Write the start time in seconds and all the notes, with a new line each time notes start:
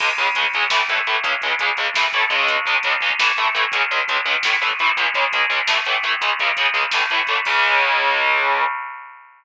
0.00 C#2 C#3 G#3, kick, crash
0.09 kick
0.18 C#2 C#3 G#3, kick, closed hi-hat
0.27 kick
0.35 C#2 C#3 G#3, kick, closed hi-hat
0.44 kick
0.53 C#2 C#3 G#3, kick, closed hi-hat
0.63 kick
0.70 A2 E3 A3, kick, snare
0.80 kick
0.89 A2 E3 A3, kick, closed hi-hat
0.98 kick
1.07 A2 E3 A3, kick, closed hi-hat
1.15 kick
1.23 C#2 C#3 G#3, kick, closed hi-hat
1.33 kick
1.42 C#2 C#3 G#3, kick, closed hi-hat
1.50 kick
1.59 C#2 C#3 G#3, kick, closed hi-hat
1.69 kick
1.77 C#2 C#3 G#3, kick, closed hi-hat
1.94 A2 E3 A3, kick, snare
2.04 kick
2.13 A2 E3 A3, kick, closed hi-hat
2.22 kick
2.30 C#2 C#3 G#3, kick, closed hi-hat
2.40 kick
2.48 kick, closed hi-hat
2.56 kick
2.66 C#2 C#3 G#3, kick, closed hi-hat
2.74 kick
2.83 C#2 C#3 G#3, kick, closed hi-hat
2.92 kick
3.01 C#2 C#3 G#3, kick, closed hi-hat
3.10 kick
3.19 A2 E3 A3, kick, snare
3.29 kick
3.37 A2 E3 A3, kick, closed hi-hat
3.45 kick
3.54 A2 E3 A3, kick, closed hi-hat
3.64 kick
3.72 C#2 C#3 G#3, kick, closed hi-hat
3.82 kick
3.91 C#2 C#3 G#3, kick, closed hi-hat
3.99 kick
4.08 C#2 C#3 G#3, kick, closed hi-hat
4.16 kick
4.25 C#2 C#3 G#3, kick, closed hi-hat
4.35 kick
4.43 A2 E3 A3, kick, snare
4.52 kick
4.62 A2 E3 A3, kick, closed hi-hat
4.71 kick
4.79 A2 E3 A3, kick, closed hi-hat
4.87 kick
4.97 C#2 C#3 G#3, kick, closed hi-hat
5.05 kick
5.14 C#2 C#3 G#3, kick, closed hi-hat
5.23 kick
5.33 C#2 C#3 G#3, kick, closed hi-hat
5.42 kick
5.50 C#2 C#3 G#3, kick, closed hi-hat
5.59 kick
5.67 A2 E3 A3, snare
5.77 kick
5.85 A2 E3 A3, kick, closed hi-hat
5.95 kick
6.03 A2 E3 A3, kick, closed hi-hat
6.13 kick
6.21 C#2 C#3 G#3, kick, closed hi-hat
6.30 kick
6.39 C#2 C#3 G#3, kick, closed hi-hat
6.48 kick
6.57 C#2 C#3 G#3, kick, closed hi-hat
6.66 kick
6.73 C#2 C#3 G#3, kick, closed hi-hat
6.83 kick
6.91 A2 E3 A3, kick, snare
7.01 kick
7.10 A2 E3 A3, kick, closed hi-hat
7.19 kick
7.27 A2 E3 A3, kick, closed hi-hat
7.36 kick
7.45 C#2 C#3 G#3, kick, crash